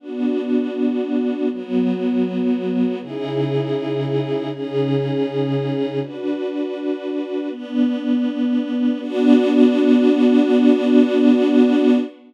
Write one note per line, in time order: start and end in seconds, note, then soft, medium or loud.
0.00 1.49 B3 medium
0.00 1.49 D4 medium
0.00 1.49 F#4 medium
1.50 2.99 F#3 medium
1.50 2.99 B3 medium
1.50 2.99 F#4 medium
3.00 4.49 C#3 medium
3.00 4.49 D#4 medium
3.00 4.49 E4 medium
3.00 4.49 G#4 medium
4.50 5.99 C#3 medium
4.50 5.99 C#4 medium
4.50 5.99 D#4 medium
4.50 5.99 G#4 medium
6.00 7.49 D4 medium
6.00 7.49 F#4 medium
6.00 7.49 B4 medium
7.50 8.98 B3 medium
7.50 8.98 D4 medium
7.50 8.98 B4 medium
9.00 11.97 B3 loud
9.00 11.97 D4 loud
9.00 11.97 F#4 loud